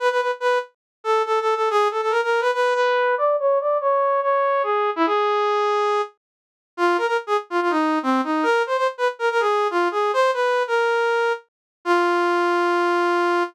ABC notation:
X:1
M:4/4
L:1/16
Q:1/4=142
K:E
V:1 name="Brass Section"
B B B z B2 z4 A2 (3A2 A2 A2 | G2 A A ^A A2 B B2 B4 =d2 | c2 =d2 c4 c4 G3 E | G10 z6 |
[K:F] F2 B B z _A z F F _E3 C2 E2 | B2 c c z _c z B B _A3 F2 A2 | c2 _c3 B7 z4 | F16 |]